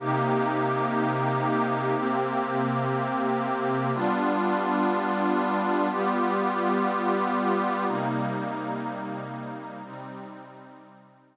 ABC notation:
X:1
M:4/4
L:1/8
Q:1/4=122
K:Cm
V:1 name="Pad 5 (bowed)"
[C,B,EG]8 | [C,B,CG]8 | [G,=B,DF]8 | [G,=B,FG]8 |
[C,G,B,E]8 | [C,G,CE]8 |]